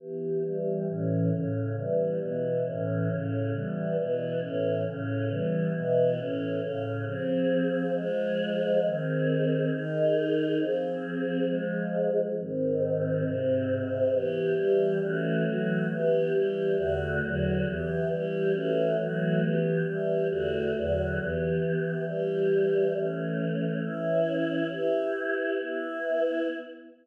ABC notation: X:1
M:4/4
L:1/8
Q:1/4=136
K:Edor
V:1 name="Choir Aahs"
[E,B,G]2 [E,G,G]2 [A,,E,C]2 [A,,C,C]2 | [E,G,B,]2 [B,,E,B,]2 [A,,E,C]2 [A,,C,C]2 | [E,G,B,]2 [B,,E,B,]2 [A,,E,C]2 [A,,C,C]2 | [E,G,B,]2 [B,,E,B,]2 [A,,E,C]2 [A,,C,C]2 |
[K:Fdor] [F,CA]4 [F,A,A]4 | [E,CA]4 [E,EA]4 | [F,CA]4 [F,A,A]4 | [A,,E,C]4 [A,,C,C]4 |
[K:Edor] [E,B,G]2 [E,G,G]2 [E,A,CF]2 [E,F,A,F]2 | [E,B,G]2 [E,G,G]2 [E,,D,A,F]2 [E,,D,F,F]2 | [E,B,G]2 [E,G,G]2 [E,A,CF]2 [E,F,A,F]2 | [E,B,G]2 [E,G,G]2 [E,,D,A,F]2 [E,,D,F,F]2 |
[E,B,G]4 [E,G,G]4 | [E,A,C]4 [E,CE]4 | [EGB]4 [B,EB]4 |]